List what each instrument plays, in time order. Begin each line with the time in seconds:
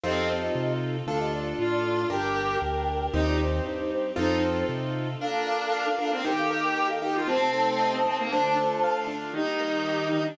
0.04 acoustic grand piano F2 C4 D#4 F4 A4, violin C4, string ensemble 1 C4 D#4 F4 A4, flute G4 D#5
0.55 acoustic grand piano C3
1.07 acoustic grand piano D2 D4 F4 A4, string ensemble 1 D4 F4 A4, flute A4 F5
1.20 flute G4 D#5
1.33 flute F4 D5
1.58 acoustic grand piano A2, violin F4, flute F4 D5
1.72 flute F4 D5
1.85 flute F4 D5
2.10 acoustic grand piano G1 D4 G4 A#4, string ensemble 1 D4 G4 A#4, violin G4, flute A#4 G5
2.62 acoustic grand piano D2
3.14 acoustic grand piano D#2 C4 D#4 G4, string ensemble 1 C4 D#4 G4, violin D#4, flute G4 D#5
3.27 flute F4 D5
3.40 flute D#4 C5
3.66 acoustic grand piano G2, flute D#4 C5
3.79 flute D#4 C5
3.92 flute D#4 C5
4.16 acoustic grand piano F2 C4 D#4 F4 A4, string ensemble 1 C4 D#4 F4 A4, violin D#4, flute D#4 C5
4.69 acoustic grand piano C3
5.20 string ensemble 1 A#3 D4 F4, violin D4, flute A4 F5, acoustic grand piano A#4
5.47 acoustic grand piano D5
5.72 acoustic grand piano F5
5.98 violin D4, acoustic grand piano A#4
6.12 violin C4
6.24 string ensemble 1 D#3 A#3 G4, acoustic grand piano D#4, violin G4, flute A#4 G5
6.37 flute A4 F5
6.51 acoustic grand piano A#4
6.63 flute A#4 G5
6.76 flute A#4 G5, acoustic grand piano G5
6.89 flute A4 F5
7.02 acoustic grand piano D#4, violin G4, flute A#4 G5
7.15 violin F4
7.27 string ensemble 1 C3 A3 D#4, violin C4, acoustic grand piano C4, flute C5 A5
7.53 acoustic grand piano A4
7.79 acoustic grand piano D#5
8.05 violin C4, acoustic grand piano C4
8.19 violin A#3
8.31 string ensemble 1 D3 A3 F4, violin D4, acoustic grand piano D4, flute C5 A5
8.56 acoustic grand piano A4
8.84 acoustic grand piano F5
9.07 acoustic grand piano D4
9.34 acoustic grand piano D#3, string ensemble 1 D#3 G3 A#3, violin D#4, flute G4 D#5
9.60 acoustic grand piano A#3
9.86 acoustic grand piano G4
10.11 acoustic grand piano D#3, violin D#4
10.26 violin D4